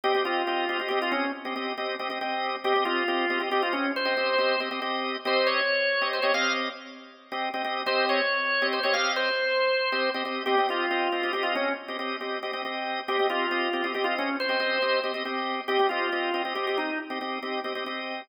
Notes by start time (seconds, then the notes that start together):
0.04 C4 G4 D#5
0.15 C4 G4 D#5
0.25 C4 F4 G4 D#5
0.47 C4 G4 D#5
0.69 C4 G4 D#5
0.80 C4 G4 D#5
0.89 C4 G4 D#5
1.02 F4
1.12 C#4
1.45 C4 G4 D#5
1.56 C4 G4 D#5
1.78 C4 G4 D#5
1.99 C4 G4 D#5
2.10 C4 G4 D#5
2.21 C4 G4 D#5
2.64 C4 G4 D#5
2.76 C4 G4 D#5
2.85 C4 F4 G4 D#5
3.08 C4 G4 D#5
3.30 C4 G4 D#5
3.40 C4 G4 D#5
3.51 C4 G4 D#5
3.63 F4
3.73 C#4
3.96 C5
4.05 C4 G4 D#5
4.17 C4 G4 D#5
4.38 C4 G4 D#5
4.60 C4 G4 D#5
4.71 C4 G4 D#5
4.82 C4 G4 D#5
5.25 C4 G4 C5 D#5
5.47 C#5
6.01 C4 G4 D#5
6.13 C5
6.22 C4 G4 C#5 D#5
6.34 C4 G4 D#5 F5
7.32 C4 G4 D#5
7.54 C4 G4 D#5
7.64 C4 G4 D#5
7.86 C4 G4 C5 D#5
8.09 C#5
8.62 C4 G4 D#5
8.73 C5
8.83 C4 G4 C#5 D#5
8.94 C4 G4 D#5 F5
9.16 C5
9.92 C4 G4 D#5
10.14 C4 G4 D#5
10.25 C4 G4 D#5
10.46 C4 G4 D#5
10.58 C4 G4 D#5
10.69 C4 F4 G4 D#5
10.91 C4 G4 D#5
11.12 C4 G4 D#5
11.23 C4 G4 D#5
11.33 C4 G4 D#5
11.43 F4
11.55 C#4
11.88 C4 G4 D#5
11.99 C4 G4 D#5
12.21 C4 G4 D#5
12.43 C4 G4 D#5
12.53 C4 G4 D#5
12.65 C4 G4 D#5
13.08 C4 G4 D#5
13.19 C4 G4 D#5
13.29 C4 F4 G4 D#5
13.51 C4 G4 D#5
13.73 C4 G4 D#5
13.84 C4 G4 D#5
13.94 C4 G4 D#5
14.04 F4
14.18 C#4
14.40 C5
14.49 C4 G4 D#5
14.60 C4 G4 D#5
14.82 C4 G4 D#5
15.04 C4 G4 D#5
15.14 C4 G4 D#5
15.25 C4 G4 D#5
15.68 C4 G4 D#5
15.79 C4 G4 D#5
15.89 C4 F4 G4 D#5
16.12 C4 G4 D#5
16.34 C4 G4 D#5
16.45 C4 G4 D#5
16.55 C4 G4 D#5
16.67 G4
16.78 D#4
17.10 C4 G4 D#5
17.21 C4 G4 D#5
17.43 C4 G4 D#5
17.64 C4 G4 D#5
17.75 C4 G4 D#5
17.86 C4 G4 D#5